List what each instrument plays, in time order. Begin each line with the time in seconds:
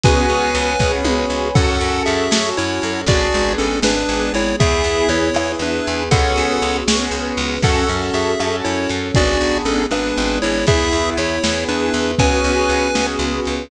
0.03 electric bass (finger) C#2, acoustic grand piano B3 C#4 F#4 G#4, pad 5 (bowed) B4 C#5 F#5 G#5, lead 1 (square) B4 G#5, kick, closed hi-hat
0.29 electric bass (finger) C#2, closed hi-hat
0.55 electric bass (finger) C#2, closed hi-hat
0.79 electric bass (finger) C#2, acoustic grand piano B3 C#4 F#4 G#4, pad 5 (bowed) B4 C#5 G#5 B5, kick, snare
1.04 electric bass (finger) C#2, high tom
1.30 electric bass (finger) C#2
1.55 electric bass (finger) F#2, acoustic grand piano C#4 F#4 A4, pad 5 (bowed) C#4 F#4 A4, lead 1 (square) A4 F#5, kick, crash
1.80 electric bass (finger) F#2, closed hi-hat
2.06 electric bass (finger) F#2, lead 1 (square) G#4 E5, closed hi-hat
2.31 electric bass (finger) F#2, acoustic grand piano C#4 F#4 A4, pad 5 (bowed) C#4 A4 C#5, snare
2.57 electric bass (finger) F#2, lead 1 (square) E4 C#5, closed hi-hat
2.82 electric bass (finger) F#2, closed hi-hat
3.06 electric bass (finger) G#1, acoustic grand piano B3 D4 G#4, pad 5 (bowed) B3 D4 G#4, lead 1 (square) F#4 D5, kick, closed hi-hat
3.33 electric bass (finger) G#1, closed hi-hat
3.58 electric bass (finger) G#1, lead 1 (square) C#4 A4, closed hi-hat
3.82 electric bass (finger) G#1, pad 5 (bowed) G#3 B3 G#4, acoustic grand piano B3 D4 G#4, lead 1 (square) D4 B4, snare
4.09 electric bass (finger) G#1, closed hi-hat
4.34 electric bass (finger) G#1, lead 1 (square) E4 C#5, closed hi-hat
4.60 electric bass (finger) E2, acoustic grand piano B3 E4 G#4, pad 5 (bowed) B3 E4 G#4, lead 1 (square) G#4 E5, kick, closed hi-hat
4.84 electric bass (finger) E2, closed hi-hat
5.09 electric bass (finger) E2, lead 1 (square) E4 C#5, closed hi-hat
5.34 electric bass (finger) E2, acoustic grand piano B3 E4 G#4, pad 5 (bowed) B3 G#4 B4, cross-stick
5.59 electric bass (finger) E2, lead 1 (square) D4 B4, closed hi-hat
5.87 electric bass (finger) E2, closed hi-hat
6.11 electric bass (finger) C#2, acoustic grand piano B3 C#4 F#4 G#4, pad 5 (bowed) B3 C#4 F#4 G#4, lead 1 (square) A4 F#5, kick, closed hi-hat
6.36 electric bass (finger) C#2, closed hi-hat
6.62 electric bass (finger) C#2, closed hi-hat
6.88 electric bass (finger) C#2, acoustic grand piano B3 C#4 F#4 G#4, pad 5 (bowed) B3 C#4 G#4 B4, snare
7.11 electric bass (finger) C#2, closed hi-hat
7.37 electric bass (finger) C#2, open hi-hat
7.62 electric bass (finger) F#2, pad 5 (bowed) C#4 F#4 A4, acoustic grand piano C#4 F#4 A4, lead 1 (square) A4 F#5, kick, crash
7.89 electric bass (finger) F#2, closed hi-hat
8.14 electric bass (finger) F#2, lead 1 (square) G#4 E5, closed hi-hat
8.39 electric bass (finger) F#2, acoustic grand piano C#4 F#4 A4, pad 5 (bowed) C#4 A4 C#5, cross-stick
8.64 electric bass (finger) F#2, lead 1 (square) E4 C#5, closed hi-hat
8.89 electric bass (finger) F#2, closed hi-hat
9.14 electric bass (finger) G#1, acoustic grand piano B3 D4 G#4, pad 5 (bowed) B3 D4 G#4, lead 1 (square) F#4 D5, kick, closed hi-hat
9.41 electric bass (finger) G#1, closed hi-hat
9.65 electric bass (finger) G#1, lead 1 (square) C#4 A4, closed hi-hat
9.91 electric bass (finger) G#1, pad 5 (bowed) G#3 B3 G#4, acoustic grand piano B3 D4 G#4, lead 1 (square) D4 B4, cross-stick
10.17 electric bass (finger) G#1, closed hi-hat
10.42 electric bass (finger) G#1, lead 1 (square) E4 C#5, closed hi-hat
10.67 electric bass (finger) E2, pad 5 (bowed) B3 E4 G#4, acoustic grand piano B3 E4 G#4, lead 1 (square) G#4 E5, kick, closed hi-hat
10.92 electric bass (finger) E2, closed hi-hat
11.17 electric bass (finger) E2, lead 1 (square) E4 C#5, closed hi-hat
11.43 electric bass (finger) E2, acoustic grand piano B3 E4 G#4, pad 5 (bowed) B3 G#4 B4, snare
11.68 electric bass (finger) E2, lead 1 (square) D4 B4, closed hi-hat
11.94 electric bass (finger) E2, closed hi-hat
12.18 electric bass (finger) C#2, acoustic grand piano B3 C#4 F#4 G#4, pad 5 (bowed) B3 C#4 F#4 G#4, lead 1 (square) B4 G#5, kick, closed hi-hat
12.44 electric bass (finger) C#2, closed hi-hat
12.69 electric bass (finger) C#2, closed hi-hat
12.95 electric bass (finger) C#2, acoustic grand piano B3 C#4 F#4 G#4, pad 5 (bowed) B3 C#4 G#4 B4, snare
13.19 electric bass (finger) C#2, closed hi-hat
13.45 electric bass (finger) C#2, closed hi-hat